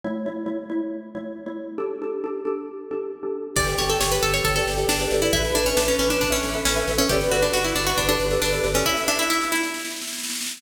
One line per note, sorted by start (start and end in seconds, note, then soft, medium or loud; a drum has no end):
0.04 0.22 A3 medium
0.04 0.22 E4 medium
0.04 0.22 C#5 medium
0.26 0.44 A3 medium
0.26 0.44 E4 medium
0.26 0.44 C#5 medium
0.46 0.64 A3 medium
0.46 0.64 E4 medium
0.46 0.64 C#5 medium
0.70 1.05 A3 medium
0.70 1.05 E4 medium
0.70 1.05 C#5 medium
1.15 1.41 A3 medium
1.15 1.41 E4 medium
1.15 1.41 C#5 medium
1.46 1.73 A3 medium
1.46 1.73 E4 medium
1.46 1.73 C#5 medium
1.78 1.96 D4 medium
1.78 1.96 G4 medium
1.78 1.96 A4 medium
2.02 2.19 D4 medium
2.02 2.19 G4 medium
2.02 2.19 A4 medium
2.24 2.41 D4 medium
2.24 2.41 G4 medium
2.24 2.41 A4 medium
2.45 2.81 D4 medium
2.45 2.81 G4 medium
2.45 2.81 A4 medium
2.91 3.18 D4 medium
2.91 3.18 G4 medium
2.91 3.18 A4 medium
3.23 3.49 D4 medium
3.23 3.49 G4 medium
3.23 3.49 A4 medium
3.56 3.75 G1 medium
3.56 5.14 G4 medium
3.56 3.74 G4 medium
3.56 3.74 A4 medium
3.56 3.74 B4 medium
3.56 3.74 D5 medium
3.56 kick medium
3.56 snare medium
3.56 crash medium
3.68 snare medium
3.78 3.97 G1 medium
3.78 4.14 G4 medium
3.78 4.14 A4 medium
3.78 4.14 B4 medium
3.78 3.89 C#5 medium
3.78 4.14 D5 medium
3.78 snare medium
3.89 4.00 A4 medium
3.89 snare medium
4.01 4.20 G1 medium
4.01 4.11 C#5 medium
4.01 snare loud
4.12 4.22 B4 medium
4.12 snare medium
4.23 4.41 G1 medium
4.23 4.33 A4 medium
4.23 snare medium
4.33 4.44 C#5 medium
4.33 snare medium
4.44 4.63 G1 medium
4.44 4.55 A4 medium
4.44 kick medium
4.44 snare medium
4.56 4.74 G4 medium
4.56 4.74 A4 medium
4.56 4.74 B4 medium
4.56 4.74 D5 medium
4.56 snare medium
4.67 4.85 G1 medium
4.67 snare medium
4.77 4.95 G4 medium
4.77 4.95 A4 medium
4.77 4.95 B4 medium
4.77 4.95 D5 medium
4.77 snare medium
4.88 5.07 G1 medium
4.88 5.20 D4 medium
4.88 snare medium
5.00 5.10 G4 medium
5.00 5.10 A4 medium
5.00 5.10 B4 medium
5.00 5.10 D5 medium
5.00 snare medium
5.11 5.30 G1 medium
5.11 5.21 G4 medium
5.11 5.21 A4 medium
5.11 5.21 B4 medium
5.11 5.21 D5 medium
5.11 snare medium
5.22 5.32 E4 medium
5.22 5.32 G4 medium
5.22 5.32 A4 medium
5.22 5.32 B4 medium
5.22 5.32 D5 medium
5.22 snare medium
5.33 5.52 A1 loud
5.33 5.54 E4 medium
5.33 5.51 A4 medium
5.33 6.82 B4 medium
5.33 5.51 B4 medium
5.33 5.51 E5 medium
5.33 kick medium
5.33 snare medium
5.45 snare medium
5.55 5.74 A1 medium
5.55 5.65 D4 medium
5.55 5.90 A4 medium
5.55 5.90 B4 medium
5.55 5.90 E5 medium
5.55 snare medium
5.66 5.76 C#4 medium
5.66 snare medium
5.77 5.95 A1 medium
5.77 5.87 D4 medium
5.77 snare loud
5.88 5.99 C#4 medium
5.88 snare medium
5.99 6.17 A1 medium
5.99 6.10 C#4 medium
5.99 snare medium
6.10 6.21 D4 medium
6.10 snare medium
6.21 6.40 A1 medium
6.21 6.32 D4 medium
6.21 kick medium
6.21 snare medium
6.30 6.51 C#4 medium
6.30 6.48 A4 medium
6.30 6.48 B4 medium
6.30 6.48 E5 medium
6.30 snare medium
6.43 6.62 A1 medium
6.43 snare medium
6.54 6.73 A4 medium
6.54 6.73 B4 medium
6.54 6.73 E5 medium
6.54 snare medium
6.65 6.84 A1 medium
6.65 6.95 C#4 medium
6.65 snare medium
6.76 6.85 A4 medium
6.76 6.85 B4 medium
6.76 6.85 E5 medium
6.76 snare medium
6.87 7.06 A1 medium
6.87 6.97 A4 medium
6.87 6.97 B4 medium
6.87 6.97 E5 medium
6.87 snare medium
6.98 7.09 C#4 medium
6.98 7.07 A4 medium
6.98 7.07 B4 medium
6.98 7.07 E5 medium
6.98 snare medium
7.09 7.29 G1 medium
7.09 7.30 G4 medium
7.09 7.29 G4 medium
7.09 7.29 A4 medium
7.09 8.66 B4 medium
7.09 7.29 B4 medium
7.09 7.29 D5 medium
7.09 kick medium
7.09 snare medium
7.21 snare medium
7.31 7.50 G1 medium
7.31 7.42 F#4 medium
7.31 7.66 G4 medium
7.31 7.66 A4 medium
7.31 7.66 B4 medium
7.31 7.66 D5 medium
7.31 snare medium
7.42 7.53 D4 medium
7.42 snare medium
7.53 7.73 G1 medium
7.53 7.64 F#4 medium
7.53 snare medium
7.64 7.75 E4 medium
7.64 snare medium
7.75 7.94 G1 medium
7.75 7.86 D4 medium
7.75 snare medium
7.87 7.97 F#4 medium
7.87 snare medium
7.97 8.17 G1 medium
7.97 8.08 D4 medium
7.97 kick medium
7.97 snare medium
8.08 8.27 D4 medium
8.08 8.25 G4 medium
8.08 8.25 A4 medium
8.08 8.25 B4 medium
8.08 8.25 D5 medium
8.08 snare medium
8.19 8.38 G1 medium
8.19 snare medium
8.31 8.49 G4 medium
8.31 8.49 A4 medium
8.31 8.49 B4 medium
8.31 8.49 D5 medium
8.31 snare medium
8.42 8.60 G1 medium
8.42 8.68 D4 medium
8.42 snare medium
8.52 8.61 G4 medium
8.52 8.61 A4 medium
8.52 8.61 B4 medium
8.52 8.61 D5 medium
8.52 snare medium
8.64 8.83 G1 medium
8.64 8.73 G4 medium
8.64 8.73 A4 medium
8.64 8.73 B4 medium
8.64 8.73 D5 medium
8.64 snare medium
8.74 8.85 C#4 medium
8.74 8.84 G4 medium
8.74 8.84 A4 medium
8.74 8.84 B4 medium
8.74 8.84 D5 medium
8.74 snare medium
8.85 9.07 E4 medium
8.85 9.05 E5 medium
8.85 kick medium
8.85 snare medium
8.97 snare medium
9.08 9.18 D4 medium
9.08 9.48 E5 medium
9.08 snare medium
9.19 9.29 E4 medium
9.19 snare medium
9.30 9.48 E4 medium
9.30 snare medium
9.41 snare medium
9.52 10.11 E4 medium
9.52 snare medium
9.63 snare medium
9.74 snare medium
9.79 snare medium
9.85 snare medium
9.90 snare medium
9.96 snare medium
10.01 snare medium
10.07 snare medium
10.13 snare medium
10.18 snare medium
10.24 snare medium
10.30 snare medium
10.35 snare medium
10.41 snare medium
10.46 snare medium
10.51 snare medium
10.57 snare medium